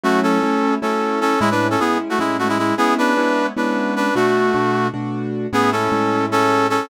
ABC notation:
X:1
M:7/8
L:1/16
Q:1/4=153
K:A
V:1 name="Brass Section"
[A,F]2 [CA]6 [CA]4 [CA]2 | [G,E] [DB]2 [CA] [B,G]2 z [A,F] [G,E]2 [A,F] [G,E] [G,E]2 | [B,G]2 [DB]6 [DB]4 [DB]2 | [A,F]8 z6 |
[B,G]2 [CA]6 [CA]4 [CA]2 |]
V:2 name="Acoustic Grand Piano"
[F,A,CE]4 [F,A,CE]4 [F,A,CE]6 | [A,,G,CE]4 [A,,G,CE]4 [A,,G,CE]6 | [G,B,CE]4 [G,B,CE]4 [G,B,CE]6 | [B,,A,DF]4 [B,,A,DF]4 [B,,A,DF]6 |
[A,,G,CE]4 [A,,G,CE]10 |]